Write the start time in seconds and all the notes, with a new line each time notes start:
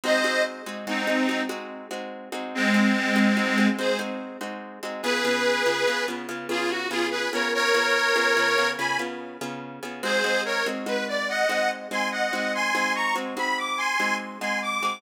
0.04 G#3 C4 D#4 F#4 C5 D#5
0.24 G#3 C4 D#4 F#4
0.66 G#3 C4 D#4 F#4
0.87 G#3 C4 D#4 F#4
1.07 G#3 C4 D#4 F#4
1.29 G#3 C4 D#4 F#4
1.49 G#3 C4 D#4 F#4
1.91 G#3 C4 D#4 F#4
2.32 G#3 C4 D#4 F#4
2.55 G#3 C4
2.74 G#3 C4 D#4 F#4
3.16 G#3 C4 D#4 F#4
3.37 G#3 C4 D#4 F#4
3.58 G#3 C4 D#4 F#4
3.78 G#3 C4 D#4 F#4 G#4 C5
3.99 G#3 C4 D#4 F#4
4.41 G#3 C4 D#4 F#4
4.83 G#3 C4 D#4 F#4
5.03 C#3 B3 F4 G#4 B4
5.25 C#3 B3 F4 G#4
5.66 C#3 B3 F4 G#4
5.87 C#3 B3 F4 G#4
6.08 C#3 B3 F4 G#4
6.29 C#3 B3 F4 G#4
6.49 C#3 B3 F4 G#4
6.70 F#4
6.90 C#3 B3 F4 G#4
7.11 G#4 B4
7.33 C#3 B3 F4 G#4 A#4 C#5
7.54 A#4 C#5
7.74 C#3 B3 F4 G#4
8.16 C#3 B3 F4 G#4
8.37 C#3 B3 F4 G#4
8.58 C#3 B3 F4 G#4
8.78 C#3 B3 F4 G#4 G#5 B5
8.99 C#3 B3 F4 G#4
9.41 C#3 B3 F4 G#4
9.83 C#3 B3 F4 G#4
10.03 G#3 C4 D#4 F#4 G#4 C5
10.24 G#3 C4 D#4 F#4
10.45 A#4 C#5
10.66 G#3 C4 D#4 F#4
10.86 G#3 C4 D#4 F#4 B4
11.08 D5
11.29 D#5 F#5
11.49 G#3 C4 D#4 F#4
11.91 G#3 C4 D#4 F#4 G#5 C6
12.11 D#5 F#5
12.33 G#3 C4 D#4 F#4
12.55 G#5 C6
12.75 G#3 C4 D#4 F#4
12.95 A#5 C#6
13.16 G#3 C4 D#4 F#4
13.37 G#3 C4 D#4 F#4 B5
13.58 D6
13.78 G#5 C6
14.00 G#3 C4 D#4 F#4
14.41 G#3 C4 D#4 F#4 G#5 C6
14.62 D6
14.83 G#3 C4 D#4 F#4